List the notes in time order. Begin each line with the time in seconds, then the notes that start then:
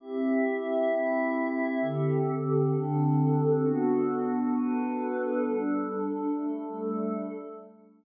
0.00 C4 E4 G4 E5
0.90 C4 E4 E5
1.81 D3 C4 G4 A4
2.73 D3 C4 D4 A4
3.63 B3 D4 F#4 A4
4.55 B3 D4 A4 B4
5.46 G3 D4 A4
6.36 G3 A3 A4